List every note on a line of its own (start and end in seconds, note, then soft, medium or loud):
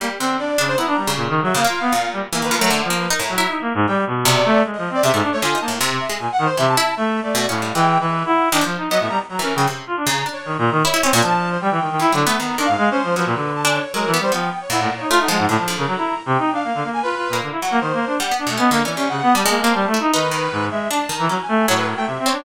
0.00 0.18 G3 medium
0.00 0.09 A#3 medium
0.19 0.55 D3 medium
0.19 0.37 C4 medium
0.39 0.56 D4 soft
0.39 0.65 D5 medium
0.58 0.76 C#3 medium
0.58 0.75 D4 loud
0.68 0.77 C5 loud
0.77 1.04 B3 medium
0.77 0.86 E4 medium
0.77 1.12 A#5 medium
0.87 0.96 D4 medium
0.97 1.14 G3 medium
1.07 1.51 C#3 medium
1.16 1.28 A#2 medium
1.29 1.40 D#3 loud
1.42 1.54 F#3 loud
1.42 1.53 E5 medium
1.54 1.63 C#3 medium
1.54 1.66 A#3 medium
1.54 2.07 F5 loud
1.64 1.90 A#3 medium
1.64 1.80 F4 medium
1.81 1.92 B3 medium
1.92 2.27 A#2 medium
2.13 2.22 G3 medium
2.32 2.41 E3 medium
2.32 2.55 A#3 medium
2.32 2.44 A#5 medium
2.42 2.51 D#3 medium
2.42 2.56 B4 loud
2.51 2.60 F3 medium
2.58 2.70 F#3 loud
2.58 2.81 A3 medium
2.58 2.69 A#4 loud
2.70 2.88 D3 medium
2.84 3.07 F3 medium
2.90 3.08 A#3 medium
3.00 3.09 B4 medium
3.10 3.19 D#4 loud
3.10 3.21 A#4 medium
3.19 3.37 A2 medium
3.19 3.34 A#5 medium
3.29 3.46 F#3 medium
3.35 3.81 E4 loud
3.35 3.47 A#5 medium
3.48 3.60 D#4 soft
3.61 3.73 A#3 medium
3.74 3.86 G#2 loud
3.87 4.05 G3 medium
3.87 3.96 G5 medium
4.07 4.42 B2 medium
4.25 4.60 C3 loud
4.25 4.60 D5 loud
4.45 4.63 A3 loud
4.65 4.76 G#3 soft
4.74 4.89 F3 medium
4.74 4.91 D#5 medium
4.90 5.02 C4 medium
4.90 5.03 D5 loud
5.03 5.12 C3 medium
5.03 5.12 C#3 medium
5.03 5.21 E5 loud
5.13 5.22 G#2 loud
5.13 5.40 A3 medium
5.23 5.31 D4 medium
5.32 5.41 A3 medium
5.32 5.41 C#5 loud
5.42 5.54 D3 medium
5.42 5.59 F4 medium
5.42 5.59 G#5 medium
5.55 5.66 D#4 medium
5.61 5.78 A#3 medium
5.61 5.70 A5 medium
5.68 5.79 A2 medium
5.80 6.07 C3 loud
5.90 5.99 C3 medium
6.00 6.17 E5 medium
6.09 6.18 G#3 medium
6.19 6.28 A#2 medium
6.19 6.31 G#5 medium
6.32 6.44 F#5 loud
6.39 6.47 D#3 loud
6.45 6.56 C5 loud
6.57 6.75 C3 loud
6.57 6.66 E3 medium
6.57 6.66 E5 loud
6.68 6.94 A5 loud
6.77 6.95 E4 loud
6.97 7.20 A3 medium
6.97 7.20 E5 medium
7.22 7.46 A3 medium
7.22 7.46 D5 medium
7.35 7.46 B2 loud
7.48 7.72 A2 medium
7.48 7.60 C#4 medium
7.48 7.71 F5 medium
7.62 7.74 G3 soft
7.74 7.97 E3 loud
7.74 8.45 G#3 medium
7.74 7.98 G5 loud
8.00 8.23 E3 medium
8.00 8.23 B4 medium
8.26 8.49 E4 loud
8.26 8.49 F#5 medium
8.52 8.61 D#3 loud
8.52 8.63 D4 medium
8.61 8.87 F3 medium
8.61 8.76 F3 medium
8.77 8.89 D#4 medium
8.90 8.99 F#3 medium
8.90 9.26 B3 medium
8.90 8.99 D#5 loud
9.00 9.09 A2 medium
9.00 9.09 E5 medium
9.09 9.18 G3 medium
9.09 9.18 A#5 loud
9.29 9.41 F#3 medium
9.29 9.41 A#5 medium
9.39 9.56 E3 medium
9.39 9.53 C#4 medium
9.39 9.54 A#4 medium
9.55 9.67 C#3 loud
9.55 9.66 F#3 medium
9.55 9.67 G5 medium
9.67 9.85 C3 medium
9.87 9.96 F4 medium
9.97 10.05 D4 medium
10.06 10.24 C#3 loud
10.06 10.29 A#5 medium
10.26 10.78 D4 medium
10.33 10.56 C#5 medium
10.45 10.57 D#3 medium
10.58 10.70 A#2 loud
10.58 10.81 A#5 medium
10.71 10.83 D#3 loud
10.84 10.93 E4 loud
10.84 11.19 C#5 medium
10.94 11.02 E4 loud
11.03 11.12 C4 medium
11.03 11.12 C#4 loud
11.13 11.22 A#2 loud
11.22 11.57 F3 medium
11.22 11.57 D4 medium
11.22 11.49 A5 loud
11.51 11.60 C5 medium
11.61 11.70 G3 medium
11.61 12.13 G5 medium
11.71 11.80 E3 medium
11.81 11.89 D#3 medium
11.90 11.99 D#3 medium
11.99 12.11 E3 medium
11.99 12.12 E4 loud
12.12 12.25 D3 loud
12.12 12.24 F#3 medium
12.26 12.37 A3 medium
12.26 12.38 B3 loud
12.39 12.57 D#3 medium
12.39 12.56 B3 medium
12.39 12.62 A#5 medium
12.58 12.67 D#3 medium
12.58 12.67 D4 medium
12.65 12.76 G#2 medium
12.65 12.88 F5 loud
12.78 12.89 G#3 loud
12.90 13.02 C#4 medium
12.90 13.14 C5 loud
13.03 13.15 F3 medium
13.16 13.25 F3 medium
13.16 13.51 F#3 medium
13.16 13.51 B4 medium
13.26 13.34 A#2 medium
13.35 13.79 D3 medium
13.55 13.64 A5 medium
13.65 13.82 D4 loud
13.65 13.73 G#5 medium
13.74 13.92 C#5 medium
13.94 14.11 F#3 medium
13.94 14.05 G#3 medium
13.94 14.11 A#4 loud
14.06 14.18 E3 medium
14.12 14.22 B3 loud
14.12 14.21 B4 medium
14.19 14.31 G3 medium
14.19 14.31 C5 loud
14.32 14.50 F3 medium
14.32 14.66 B3 medium
14.32 14.59 G5 medium
14.61 14.70 C#5 medium
14.70 15.05 A#2 medium
14.70 14.79 E4 medium
14.70 14.94 F#5 medium
14.80 14.89 A2 medium
14.97 15.09 D#4 medium
14.97 15.20 C#5 medium
15.10 15.28 A3 loud
15.10 15.18 F4 loud
15.19 15.28 D#4 medium
15.19 15.46 F#5 medium
15.28 15.46 F3 loud
15.28 15.38 G#3 medium
15.38 15.47 G#2 medium
15.48 15.57 A2 loud
15.48 15.66 D3 medium
15.48 15.74 A5 medium
15.58 15.76 F3 medium
15.68 16.20 D3 medium
15.77 15.86 C#3 medium
15.77 15.87 A#4 medium
15.87 15.96 F#3 medium
15.87 16.22 A#5 medium
15.97 16.14 E4 medium
16.26 16.37 C3 loud
16.26 16.52 G5 medium
16.38 16.50 D#4 medium
16.51 16.63 D4 medium
16.51 16.89 F5 medium
16.64 16.73 A#3 medium
16.74 16.83 D3 medium
16.84 17.01 A#3 medium
16.94 17.02 G#5 loud
17.03 17.15 F4 medium
17.03 17.37 B4 loud
17.16 17.28 F4 medium
17.29 17.41 A#2 medium
17.29 17.59 A#3 medium
17.42 17.51 D3 soft
17.51 17.60 E4 medium
17.61 17.80 F#3 medium
17.61 17.79 F#5 medium
17.71 17.80 A#3 loud
17.80 17.92 D#3 medium
17.80 18.15 C5 medium
17.93 18.05 A#3 medium
18.06 18.18 D4 medium
18.19 18.31 G3 medium
18.19 18.37 F#5 medium
18.31 18.43 B3 medium
18.39 18.47 D4 medium
18.46 18.58 B2 medium
18.46 18.57 A3 medium
18.57 18.70 B3 loud
18.57 18.69 C#4 medium
18.57 18.81 D#5 medium
18.71 18.83 D3 medium
18.71 18.83 A#3 loud
18.84 18.96 E3 medium
18.84 18.97 C#4 medium
18.84 19.07 D5 medium
18.97 19.32 C3 soft
18.97 19.08 C#4 medium
19.09 19.21 C#3 medium
19.09 19.32 F#5 loud
19.23 19.34 B3 loud
19.35 19.44 G3 medium
19.35 19.47 G3 medium
19.35 19.87 A5 medium
19.45 19.63 G#3 loud
19.45 19.60 A#3 medium
19.61 19.73 A#3 loud
19.61 19.90 C4 medium
19.74 19.86 G3 medium
19.87 19.99 A3 medium
19.94 20.11 E4 medium
20.00 20.12 D#4 medium
20.13 20.48 D#3 medium
20.13 20.31 D#4 loud
20.13 20.65 B4 loud
20.31 20.84 D#3 medium
20.52 20.69 G#2 medium
20.71 20.88 G#3 medium
20.71 20.88 E5 medium
20.90 20.99 D4 medium
20.90 21.08 D4 medium
20.90 21.14 A5 loud
21.09 21.27 D#3 medium
21.16 21.28 E3 loud
21.16 21.40 A#5 medium
21.29 21.38 F#3 medium
21.29 21.64 C#4 medium
21.42 21.65 G#5 medium
21.48 21.66 A3 loud
21.68 21.94 A2 medium
21.68 22.20 F#3 medium
21.68 21.76 C#5 loud
21.77 21.86 B4 loud
21.87 21.96 A#4 medium
21.97 22.05 A3 medium
21.97 22.06 G5 loud
22.06 22.18 C3 medium
22.06 22.24 E5 medium
22.19 22.31 C4 medium
22.25 22.43 C4 medium
22.25 22.43 C#5 loud
22.32 22.44 D4 medium